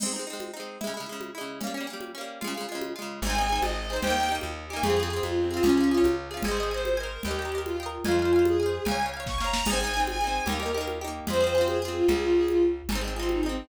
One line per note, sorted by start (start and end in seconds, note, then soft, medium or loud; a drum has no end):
0.00 0.12 C4 loud
0.00 0.12 D#4 medium
0.00 crash loud
0.00 low conga medium
0.06 0.12 G#3 medium
0.13 0.25 C4 medium
0.13 0.25 D#4 medium
0.19 0.25 G#3 medium
0.27 0.52 C4 medium
0.27 0.52 D#4 medium
0.33 0.52 G#3 medium
0.40 high conga medium
0.54 0.78 C4 medium
0.54 0.78 D#4 medium
0.60 0.78 G#3 medium
0.81 0.93 G#3 medium
0.81 0.93 E4 medium
0.81 low conga medium
0.87 0.93 C#3 medium
0.94 1.06 G#3 medium
0.94 1.06 E4 medium
1.00 1.06 C#3 medium
1.06 1.31 G#3 medium
1.06 1.31 E4 medium
1.12 1.31 C#3 medium
1.21 high conga medium
1.35 1.59 G#3 medium
1.35 1.59 E4 medium
1.41 1.59 C#3 medium
1.61 1.73 A#3 medium
1.61 1.73 C#4 medium
1.61 low conga medium
1.67 1.73 G3 medium
1.74 1.87 A#3 medium
1.74 1.87 C#4 medium
1.80 1.87 G3 medium
1.87 2.12 A#3 medium
1.87 2.12 C#4 medium
1.93 2.12 G3 medium
2.01 high conga medium
2.15 2.39 A#3 medium
2.15 2.39 C#4 medium
2.21 2.39 G3 medium
2.41 2.54 G#3 medium
2.41 2.54 F4 medium
2.41 low conga medium
2.47 2.54 C#3 loud
2.54 2.67 G#3 medium
2.54 2.67 F4 medium
2.61 2.67 C#3 medium
2.69 2.93 G#3 medium
2.69 2.93 F4 medium
2.75 2.93 C#3 medium
2.81 high conga medium
2.96 3.20 G#3 medium
2.96 3.20 F4 medium
3.02 3.20 C#3 medium
3.22 3.59 G#1 medium
3.22 3.35 G#4 loud
3.22 3.56 G#5 medium
3.22 low conga medium
3.27 3.36 C4 loud
3.27 3.36 D#4 loud
3.35 3.47 D#4 loud
3.35 3.47 G#4 medium
3.41 3.47 C4 medium
3.49 3.86 D#4 medium
3.49 3.86 G#4 medium
3.55 3.86 C4 medium
3.62 3.99 G#1 medium
3.62 3.75 D#5 medium
3.62 high conga medium
3.77 3.88 D#5 medium
3.89 4.02 G#4 medium
3.89 4.02 C5 medium
3.93 4.02 C4 medium
3.93 4.02 D#4 medium
4.02 4.40 D#2 medium
4.02 4.16 G4 loud
4.02 4.29 G5 loud
4.02 low conga medium
4.07 4.16 A#3 loud
4.07 4.16 D#4 loud
4.17 4.29 D#4 medium
4.17 4.28 G4 medium
4.23 4.29 A#3 medium
4.29 4.66 D#4 medium
4.29 4.66 G4 medium
4.35 4.66 A#3 medium
4.41 4.80 D#2 medium
4.41 high conga medium
4.69 4.83 D#4 medium
4.69 4.83 G4 medium
4.69 4.81 G#5 medium
4.76 4.83 A#3 medium
4.83 5.20 F2 medium
4.83 4.96 F4 medium
4.83 5.16 G#4 loud
4.83 4.96 G#4 loud
4.83 low conga medium
4.90 4.96 C4 loud
4.96 5.09 F4 medium
4.96 5.09 G#4 medium
5.03 5.09 C4 loud
5.10 5.47 F4 medium
5.10 5.47 G#4 medium
5.16 5.47 C4 medium
5.22 5.60 F2 medium
5.22 5.35 F4 medium
5.22 high conga medium
5.37 5.49 C4 medium
5.51 5.63 F4 medium
5.51 5.62 G#4 medium
5.57 5.63 C4 medium
5.63 6.01 C#2 medium
5.63 5.87 C#4 loud
5.63 5.75 F4 medium
5.63 5.75 G#4 loud
5.63 low conga medium
5.69 5.75 C#4 loud
5.77 5.90 F4 medium
5.77 5.90 G#4 medium
5.84 5.90 C#4 medium
5.90 6.02 F4 medium
5.90 6.28 G#4 medium
5.94 6.28 C#4 medium
5.94 6.28 F4 medium
6.04 6.41 C#2 medium
6.04 high conga medium
6.31 6.43 F4 medium
6.31 6.43 G#4 medium
6.37 6.43 C#4 medium
6.43 7.18 G#1 medium
6.43 6.70 G#4 loud
6.43 6.56 G#5 loud
6.43 low conga medium
6.48 6.58 C5 loud
6.48 6.58 D#5 loud
6.57 6.69 D#5 medium
6.57 6.69 G#5 medium
6.63 6.69 C5 medium
6.71 6.96 C5 medium
6.71 6.96 D#5 medium
6.71 6.96 G#5 medium
6.77 6.96 C5 medium
6.85 high conga medium
6.97 7.21 A#4 medium
6.97 7.22 D#5 medium
6.97 7.22 G#5 loud
7.03 7.22 C5 medium
7.23 7.99 D#2 medium
7.23 7.60 G4 medium
7.23 7.37 G5 medium
7.23 low conga medium
7.28 7.37 A#4 loud
7.28 7.37 D#5 medium
7.39 7.51 D#5 medium
7.39 7.51 G5 medium
7.45 7.51 A#4 medium
7.52 7.76 D#5 medium
7.52 7.76 G5 medium
7.58 7.76 A#4 medium
7.64 7.86 F4 medium
7.64 high conga medium
7.80 8.05 D#5 medium
7.80 8.05 G5 medium
7.86 8.05 A#4 medium
8.04 8.79 F2 medium
8.04 8.44 F4 medium
8.04 8.18 F5 loud
8.04 8.18 G#5 loud
8.04 low conga medium
8.11 8.18 C5 medium
8.19 8.31 F5 medium
8.19 8.31 G#5 medium
8.25 8.31 C5 medium
8.33 8.57 F5 medium
8.33 8.57 G#5 medium
8.39 8.57 C5 medium
8.45 8.82 G#4 medium
8.45 high conga medium
8.60 8.84 F5 medium
8.60 8.84 G#5 medium
8.66 8.84 C5 medium
8.85 9.60 C#2 medium
8.85 8.98 F5 loud
8.85 8.98 G#5 medium
8.85 low conga medium
8.91 8.98 C#5 medium
9.00 9.12 F5 medium
9.00 9.12 G#5 medium
9.06 9.12 C#5 medium
9.14 9.38 F5 medium
9.14 9.38 G#5 medium
9.20 9.38 C#5 medium
9.26 9.37 C#6 medium
9.26 kick medium
9.26 snare medium
9.38 9.63 F5 medium
9.38 9.63 G#5 medium
9.38 9.65 A#5 medium
9.38 snare medium
9.45 9.63 C#5 medium
9.53 snare loud
9.65 10.40 G#1 medium
9.65 9.79 G#4 loud
9.65 9.99 G#5 loud
9.65 crash medium
9.65 low conga loud
9.70 9.79 C4 loud
9.70 9.79 D#4 loud
9.81 9.93 D#4 medium
9.81 9.93 G#4 medium
9.87 9.93 C4 medium
9.94 10.18 D#4 medium
9.94 10.18 G#4 medium
10.00 10.18 C4 medium
10.07 10.42 G#5 medium
10.07 high conga medium
10.21 10.45 D#4 medium
10.21 10.45 G#4 medium
10.27 10.45 C4 medium
10.46 11.21 D#2 medium
10.46 10.58 D#4 loud
10.46 10.58 G4 medium
10.46 10.72 A#4 medium
10.46 low conga medium
10.52 10.58 A#3 medium
10.60 10.72 D#4 medium
10.60 10.72 G4 medium
10.66 10.72 A#3 medium
10.74 10.99 D#4 loud
10.74 10.99 G4 medium
10.74 10.86 A#4 medium
10.81 10.99 A#3 medium
10.88 high conga medium
11.01 11.26 D#4 medium
11.01 11.26 G4 medium
11.08 11.26 A#3 medium
11.27 12.02 F2 medium
11.27 11.40 F4 loud
11.27 11.40 G#4 medium
11.27 11.68 C5 loud
11.27 low conga medium
11.33 11.40 C4 loud
11.40 11.53 F4 medium
11.40 11.53 G#4 medium
11.47 11.53 C4 medium
11.55 11.79 F4 medium
11.55 11.79 G#4 medium
11.61 11.79 C4 medium
11.67 11.78 G#4 medium
11.67 high conga medium
11.81 11.93 G#4 medium
11.81 12.07 G#4 medium
11.85 12.07 C4 medium
11.85 12.07 F4 medium
11.96 12.07 F4 medium
12.08 12.82 C#2 medium
12.08 12.21 G#4 medium
12.08 low conga medium
12.21 12.34 F4 medium
12.35 12.46 G#4 medium
12.48 12.61 F4 medium
12.48 high conga medium
12.89 13.63 G#1 medium
12.89 13.01 D#4 loud
12.89 13.01 G#4 loud
12.89 low conga medium
12.95 13.01 C4 loud
13.01 13.14 D#4 medium
13.01 13.14 G#4 medium
13.08 13.14 C4 medium
13.15 13.26 F4 medium
13.15 13.41 G#4 medium
13.19 13.41 C4 medium
13.19 13.41 D#4 medium
13.29 13.42 D#4 medium
13.29 high conga medium
13.42 13.67 C4 medium
13.42 13.68 G#4 medium
13.46 13.68 C4 medium
13.46 13.68 D#4 medium